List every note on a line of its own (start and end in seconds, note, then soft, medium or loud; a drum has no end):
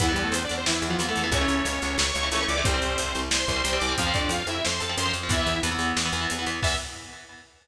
0.00 0.15 E2 loud
0.00 0.06 E3 medium
0.00 0.12 E3 medium
0.00 0.06 B3 loud
0.00 0.12 E4 medium
0.00 kick loud
0.00 closed hi-hat loud
0.09 0.35 E3 medium
0.09 0.22 G3 medium
0.09 0.35 B3 loud
0.09 0.22 G4 medium
0.16 0.30 E2 loud
0.16 closed hi-hat medium
0.22 0.33 A3 medium
0.22 0.33 A4 medium
0.31 0.46 E2 loud
0.31 0.42 C4 medium
0.31 0.42 C5 medium
0.31 closed hi-hat loud
0.44 0.55 D4 medium
0.44 0.55 D5 medium
0.49 0.65 E2 loud
0.49 closed hi-hat medium
0.57 0.68 C4 medium
0.57 0.68 C5 medium
0.66 0.80 E2 medium
0.66 0.87 E3 medium
0.66 0.87 E4 medium
0.66 snare loud
0.82 0.96 E2 loud
0.82 closed hi-hat medium
0.88 0.97 E3 medium
0.88 1.08 F3 medium
0.88 0.97 B3 medium
0.88 1.08 F4 medium
0.99 1.13 E2 loud
0.99 1.06 E3 medium
0.99 1.06 B3 medium
0.99 closed hi-hat loud
1.09 1.22 E3 medium
1.09 1.27 A3 medium
1.09 1.22 B3 medium
1.09 1.27 A4 medium
1.16 1.31 E2 medium
1.16 closed hi-hat medium
1.24 1.30 E3 medium
1.24 1.30 B3 medium
1.32 1.46 C#2 loud
1.32 1.39 E3 medium
1.32 1.39 A3 medium
1.32 1.39 C#4 loud
1.32 1.98 C#4 medium
1.32 1.98 C#5 medium
1.32 kick loud
1.32 closed hi-hat loud
1.41 1.68 E3 medium
1.41 1.68 A3 medium
1.41 1.68 C#4 medium
1.48 1.62 C#2 loud
1.48 closed hi-hat medium
1.65 1.79 C#2 loud
1.65 closed hi-hat loud
1.82 1.96 C#2 loud
1.82 closed hi-hat medium
1.98 2.12 C#2 loud
1.98 2.13 C#5 medium
1.98 2.13 C#6 medium
1.98 snare loud
2.13 2.29 C#2 loud
2.13 2.27 C#5 medium
2.13 2.27 C#6 medium
2.13 closed hi-hat medium
2.23 2.30 E3 medium
2.23 2.30 A3 medium
2.23 2.30 C#4 medium
2.31 2.45 C#2 medium
2.31 2.39 E3 medium
2.31 2.39 A3 medium
2.31 2.39 C#4 medium
2.31 2.45 C#5 medium
2.31 2.45 C#6 medium
2.31 closed hi-hat loud
2.40 2.54 E3 medium
2.40 2.54 A3 medium
2.40 2.54 C#4 medium
2.48 2.63 C#2 loud
2.48 2.64 D5 medium
2.48 2.64 D6 medium
2.48 closed hi-hat medium
2.58 2.64 E3 medium
2.58 2.64 A3 medium
2.58 2.64 C#4 medium
2.64 2.80 C2 loud
2.64 2.72 G3 loud
2.64 3.20 C4 medium
2.64 2.72 C4 loud
2.64 3.20 C5 medium
2.64 kick loud
2.64 closed hi-hat loud
2.74 3.00 G3 medium
2.74 3.00 C4 medium
2.82 2.96 C2 loud
2.82 closed hi-hat medium
2.98 3.13 C2 loud
2.98 closed hi-hat loud
3.15 3.29 C2 loud
3.15 closed hi-hat medium
3.31 3.45 C2 medium
3.31 3.48 C5 medium
3.31 3.48 C6 medium
3.31 snare loud
3.48 3.62 C2 loud
3.48 3.63 C5 medium
3.48 3.63 C6 medium
3.48 kick medium
3.48 closed hi-hat medium
3.56 3.63 G3 medium
3.56 3.63 C4 medium
3.63 3.79 C2 loud
3.63 3.71 G3 medium
3.63 3.71 C4 medium
3.63 3.78 C5 medium
3.63 3.78 C6 medium
3.63 closed hi-hat loud
3.73 3.86 G3 medium
3.73 3.86 C4 medium
3.79 3.95 C2 loud
3.79 3.93 D5 medium
3.79 3.93 D6 medium
3.79 closed hi-hat medium
3.89 3.96 G3 medium
3.89 3.96 C4 medium
3.98 4.13 F2 loud
3.98 4.05 F3 loud
3.98 4.05 C4 medium
3.98 4.13 F4 medium
3.98 4.13 F5 medium
3.98 kick loud
3.98 closed hi-hat loud
4.07 4.33 F3 medium
4.07 4.33 C4 medium
4.14 4.28 F2 loud
4.14 4.29 D4 medium
4.14 4.29 D5 medium
4.14 kick loud
4.14 closed hi-hat medium
4.29 4.43 F2 loud
4.29 4.47 F4 medium
4.29 4.47 F5 medium
4.29 closed hi-hat loud
4.47 4.61 F2 loud
4.47 4.63 E4 medium
4.47 4.63 E5 medium
4.47 closed hi-hat medium
4.64 4.80 F2 loud
4.64 4.80 C5 medium
4.64 4.80 C6 medium
4.64 snare loud
4.80 4.96 F2 medium
4.80 4.96 A4 medium
4.80 4.96 A5 medium
4.80 closed hi-hat medium
4.89 4.96 F3 medium
4.89 4.96 C4 medium
4.97 5.12 F#2 medium
4.97 5.04 F3 medium
4.97 5.04 C4 medium
4.97 5.12 C5 medium
4.97 5.12 C6 medium
4.97 closed hi-hat loud
5.06 5.19 F3 medium
5.06 5.19 C4 medium
5.13 5.29 F2 loud
5.13 closed hi-hat medium
5.23 5.30 F3 medium
5.23 5.30 C4 medium
5.29 5.43 E2 loud
5.29 5.37 E3 loud
5.29 5.37 B3 loud
5.29 5.60 E4 medium
5.29 5.60 E5 medium
5.29 kick loud
5.29 closed hi-hat loud
5.39 5.59 E3 medium
5.39 5.59 B3 medium
5.46 5.60 E2 medium
5.46 closed hi-hat medium
5.63 5.77 E2 loud
5.63 5.70 E3 medium
5.63 5.70 B3 medium
5.63 closed hi-hat loud
5.71 5.98 E3 medium
5.71 5.98 B3 loud
5.79 5.93 E2 loud
5.79 closed hi-hat medium
5.97 6.11 E2 loud
5.97 snare loud
6.05 6.12 E3 medium
6.05 6.12 B3 medium
6.13 6.27 E2 loud
6.13 6.20 E3 medium
6.13 6.20 B3 medium
6.13 closed hi-hat medium
6.21 6.34 E3 medium
6.21 6.34 B3 medium
6.30 6.45 E2 medium
6.30 closed hi-hat loud
6.39 6.45 E3 medium
6.39 6.45 B3 medium
6.46 6.60 E2 loud
6.46 6.60 E3 medium
6.46 6.60 B3 medium
6.46 closed hi-hat medium
6.63 6.76 E2 loud
6.63 6.74 E3 loud
6.63 6.74 B3 medium
6.63 6.75 E5 loud
6.63 kick loud
6.63 crash loud